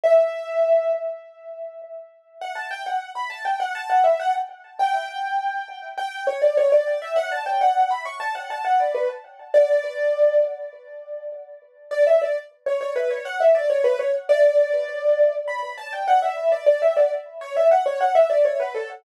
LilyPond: \new Staff { \time 4/4 \key b \minor \tempo 4 = 101 e''4. r2 r8 | \key d \major fis''16 a''16 g''16 fis''8 b''16 a''16 g''16 fis''16 a''16 fis''16 e''16 fis''16 r8. | g''2 g''8 cis''16 d''16 cis''16 d''8 e''16 | fis''16 a''16 g''16 fis''8 b''16 cis'''16 a''16 fis''16 a''16 fis''16 d''16 b'16 r8. |
d''4. r2 r8 | \key b \minor d''16 e''16 d''16 r8 cis''16 cis''16 b'16 cis''16 fis''16 e''16 d''16 cis''16 b'16 cis''16 r16 | d''2 b''8 a''16 g''16 fis''16 e''8 d''16 | d''16 e''16 d''16 r8 cis''16 e''16 fis''16 cis''16 fis''16 e''16 d''16 cis''16 b'16 a'16 r16 | }